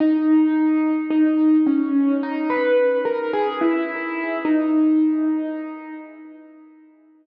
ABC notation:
X:1
M:4/4
L:1/16
Q:1/4=54
K:G#m
V:1 name="Acoustic Grand Piano"
D4 D2 C2 D B2 A G E3 | D6 z10 |]